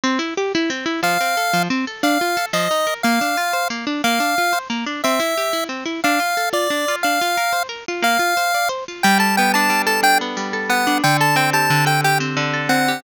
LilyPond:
<<
  \new Staff \with { instrumentName = "Lead 1 (square)" } { \time 6/8 \key f \major \tempo 4. = 120 r2. | f''2 r4 | f''4. ees''4. | f''2 r4 |
f''2 r4 | e''2 r4 | f''4. d''4. | f''2 r4 |
f''2 r4 | \key g \major g''8 a''8 g''8 a''4 a''8 | g''8 r4. fis''4 | g''8 a''8 g''8 a''4 g''8 |
g''8 r4. fis''4 | }
  \new Staff \with { instrumentName = "Acoustic Guitar (steel)" } { \time 6/8 \key f \major c'8 e'8 g'8 e'8 c'8 e'8 | f8 c'8 a'8 f8 c'8 a'8 | d'8 f'8 a'8 f8 ees'8 bes'8 | bes8 d'8 f'8 c''8 bes8 d'8 |
bes8 d'8 f'8 c''8 bes8 d'8 | c'8 e'8 g'8 e'8 c'8 e'8 | d'8 f'8 a'8 f'8 d'8 f'8 | d'8 f'8 bes'8 c''8 bes'8 f'8 |
bes8 f'8 c''8 d''8 c''8 f'8 | \key g \major g8 a'8 b8 d'8 g8 a'8 | d'8 b8 g8 a'8 b8 d'8 | d8 a'8 c'8 g'8 d8 a'8 |
g'8 c'8 d8 a'8 c'8 g'8 | }
>>